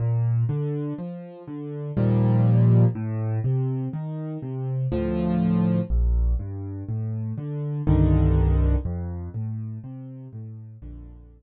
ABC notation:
X:1
M:3/4
L:1/8
Q:1/4=61
K:Bb
V:1 name="Acoustic Grand Piano" clef=bass
B,, D, F, D, [E,,B,,F,G,]2 | A,, C, E, C, [D,,A,,F,]2 | B,,, G,, A,, D, [C,,G,,D,E,]2 | F,, A,, C, A,, [B,,,F,,D,]2 |]